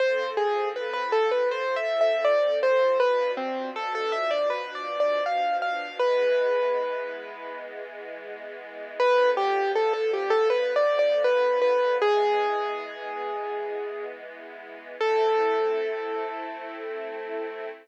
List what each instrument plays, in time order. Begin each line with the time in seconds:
0.00 string ensemble 1 F3 C4 A4, acoustic grand piano C5
0.37 acoustic grand piano G#4
0.76 acoustic grand piano B4
0.93 acoustic grand piano B4
1.12 acoustic grand piano A4
1.31 acoustic grand piano B4
1.51 acoustic grand piano C5
1.76 acoustic grand piano E5
2.01 acoustic grand piano E5
2.25 acoustic grand piano D5
2.63 acoustic grand piano C5
3.00 string ensemble 1 B2 F3 D4, acoustic grand piano B4
3.37 acoustic grand piano C4
3.76 acoustic grand piano A4
3.95 acoustic grand piano A4
4.12 acoustic grand piano E5
4.31 acoustic grand piano D5
4.50 acoustic grand piano B4
4.75 acoustic grand piano D5
5.00 acoustic grand piano D5
5.26 acoustic grand piano F5
5.62 acoustic grand piano F5
6.00 string ensemble 1 E3 G#3 B3, acoustic grand piano B4
9.00 string ensemble 1 D3 F3 B3, acoustic grand piano B4
9.37 acoustic grand piano G4
9.75 acoustic grand piano A4
9.93 acoustic grand piano A4
10.13 acoustic grand piano G4
10.30 acoustic grand piano A4
10.50 acoustic grand piano B4
10.76 acoustic grand piano D5
10.99 acoustic grand piano D5
11.24 acoustic grand piano B4
11.62 acoustic grand piano B4
11.99 string ensemble 1 E3 G#3 B3, acoustic grand piano G#4
14.99 string ensemble 1 A3 C4 E4, acoustic grand piano A4